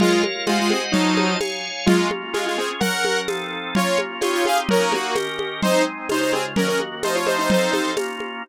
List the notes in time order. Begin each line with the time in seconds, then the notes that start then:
0.00 G#3 F4 A#4 C#5 F5, low conga
0.23 high conga
0.47 G#3 F4 C5 D#5 F#5, tambourine, high conga
0.59 G#3 F4
0.70 C4 G#4, high conga
0.92 F#3 D#4 F4 C5 D#5 A5, low conga
1.17 high conga
1.40 C#5 F5 G#5, tambourine, high conga
1.86 G#3 A#3 C#4 F4, low conga
2.11 high conga
2.33 G#3 C#4 F4 G#4, tambourine, high conga
2.46 G#3 F4
2.58 C4 G#4
2.80 F#3 C#4 A#4 F#5, low conga
3.05 high conga
3.28 F3 C4 D#4 A4, tambourine, high conga
3.75 A#3 C#4 F4 C#5, low conga
3.98 high conga
4.21 C4 D#4 F4 G4 C#5, tambourine, high conga
4.33 F4 C#5
4.45 G#4 F5, high conga
4.69 A#3 C#4 D#4 F#4 A#4, low conga
4.92 A#3 F#4, high conga
5.15 D#3 C#4 G4 A#4, tambourine, high conga
5.39 high conga
5.62 G#3 C4 D#4 C5, low conga
6.09 C#3 G#3 D#4 F4 C5, tambourine, high conga
6.21 D#4 C5
6.33 C4 G#4, high conga
6.56 D#3 A#3 C#4 F#4 A#4, low conga
6.68 C#4 A#4
6.80 high conga
7.03 F3 A3 C4 D#4 C5, tambourine, high conga
7.15 F4 C#5
7.26 D#4 C5, high conga
7.38 D#4 C5
7.50 F3 C4 D#4 A4 C5, low conga
7.72 D#4 C5, high conga
7.97 A#3 C#4 F4, tambourine, high conga
8.20 high conga